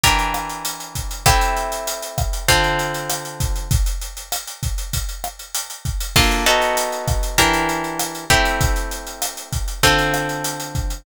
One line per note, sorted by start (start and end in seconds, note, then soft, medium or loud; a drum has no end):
0.04 1.24 E3 medium
0.04 1.24 D4 medium
0.04 1.24 G4 medium
0.04 1.24 A#4 medium
0.04 kick medium
0.04 closed hi-hat loud
0.19 closed hi-hat medium
0.34 cross-stick loud
0.34 closed hi-hat medium
0.49 closed hi-hat medium
0.65 closed hi-hat loud
0.80 closed hi-hat medium
0.95 kick medium
0.95 closed hi-hat loud
1.11 closed hi-hat medium
1.26 2.46 A3 medium
1.26 2.46 C4 medium
1.26 2.46 E4 medium
1.26 2.46 G4 medium
1.26 kick loud
1.26 cross-stick loud
1.26 closed hi-hat loud
1.41 closed hi-hat loud
1.57 closed hi-hat medium
1.72 closed hi-hat medium
1.87 closed hi-hat loud
2.03 closed hi-hat medium
2.18 kick loud
2.18 cross-stick loud
2.18 closed hi-hat medium
2.33 closed hi-hat medium
2.48 3.68 D3 medium
2.48 3.68 C4 medium
2.48 3.68 F4 medium
2.48 3.68 A4 medium
2.48 kick medium
2.48 closed hi-hat loud
2.64 closed hi-hat medium
2.79 closed hi-hat medium
2.94 closed hi-hat medium
3.10 cross-stick loud
3.10 closed hi-hat loud
3.25 closed hi-hat medium
3.40 kick loud
3.40 closed hi-hat loud
3.56 closed hi-hat medium
3.71 kick loud
3.71 closed hi-hat loud
3.86 closed hi-hat medium
4.02 closed hi-hat medium
4.17 closed hi-hat medium
4.32 cross-stick loud
4.32 closed hi-hat loud
4.47 closed hi-hat medium
4.63 kick medium
4.63 closed hi-hat medium
4.78 closed hi-hat medium
4.93 kick medium
4.93 closed hi-hat loud
5.09 closed hi-hat medium
5.24 cross-stick loud
5.24 closed hi-hat medium
5.39 closed hi-hat medium
5.55 closed hi-hat loud
5.70 closed hi-hat medium
5.85 kick medium
5.85 closed hi-hat medium
6.01 closed hi-hat loud
6.16 6.45 A#3 medium
6.16 6.45 D4 medium
6.16 6.45 F4 medium
6.16 6.45 A4 medium
6.16 kick loud
6.16 cross-stick loud
6.16 crash loud
6.31 closed hi-hat medium
6.46 7.37 B3 medium
6.46 7.37 D#4 medium
6.46 7.37 F#4 medium
6.46 7.37 A4 medium
6.46 closed hi-hat loud
6.62 closed hi-hat medium
6.77 closed hi-hat loud
6.92 closed hi-hat medium
7.08 kick loud
7.08 cross-stick medium
7.08 closed hi-hat loud
7.23 closed hi-hat medium
7.38 8.25 E3 medium
7.38 8.25 D4 medium
7.38 8.25 G4 medium
7.38 8.25 A#4 medium
7.38 kick medium
7.38 closed hi-hat loud
7.54 closed hi-hat loud
7.69 closed hi-hat medium
7.84 closed hi-hat medium
7.99 cross-stick loud
7.99 closed hi-hat loud
8.15 closed hi-hat medium
8.30 9.81 A3 medium
8.30 9.81 C4 medium
8.30 9.81 E4 medium
8.30 9.81 G4 medium
8.30 kick medium
8.30 closed hi-hat medium
8.45 closed hi-hat medium
8.61 kick loud
8.61 closed hi-hat loud
8.76 closed hi-hat medium
8.91 closed hi-hat medium
9.07 closed hi-hat medium
9.22 cross-stick loud
9.22 closed hi-hat loud
9.37 closed hi-hat medium
9.53 kick medium
9.53 closed hi-hat loud
9.68 closed hi-hat medium
9.83 11.03 D3 medium
9.83 11.03 C4 medium
9.83 11.03 F4 medium
9.83 11.03 A4 medium
9.83 kick medium
9.83 closed hi-hat loud
9.99 closed hi-hat medium
10.14 cross-stick loud
10.14 closed hi-hat medium
10.29 closed hi-hat medium
10.44 closed hi-hat loud
10.60 closed hi-hat medium
10.75 kick medium
10.75 closed hi-hat medium
10.90 closed hi-hat medium